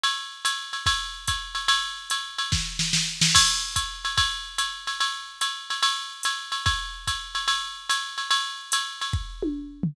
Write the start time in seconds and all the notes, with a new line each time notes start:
0.04 ride
0.45 hi-hat pedal, ride
0.73 ride
0.86 kick, ride
1.27 kick, hi-hat pedal, ride
1.55 ride
1.68 ride
2.10 hi-hat pedal, ride
2.38 ride
2.52 kick, snare
2.79 snare
2.93 snare
3.21 snare
3.35 kick, crash, ride
3.76 kick, hi-hat pedal, ride
4.05 ride
4.17 kick, ride
4.58 hi-hat pedal, ride
4.87 ride
5.01 ride
5.41 hi-hat pedal, ride
5.70 ride
5.83 ride
6.23 hi-hat pedal, ride
6.52 ride
6.66 kick, ride
7.07 kick, hi-hat pedal, ride
7.35 ride
7.48 ride
7.89 hi-hat pedal, ride
8.18 ride
8.31 ride
8.72 hi-hat pedal, ride
9.01 ride
9.13 kick
9.43 high tom
9.83 floor tom